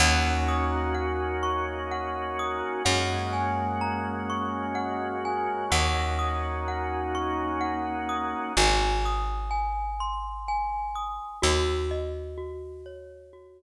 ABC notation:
X:1
M:3/4
L:1/8
Q:1/4=63
K:Ebdor
V:1 name="Glockenspiel"
g e' g d' g e' | g a b d' g a | g e' g d' g e' | a e' a c' a e' |
G e G d G z |]
V:2 name="Drawbar Organ"
[B,DEG]6 | [A,B,DG]6 | [B,DEG]6 | z6 |
z6 |]
V:3 name="Electric Bass (finger)" clef=bass
E,,6 | G,,6 | E,,6 | A,,,6 |
E,,6 |]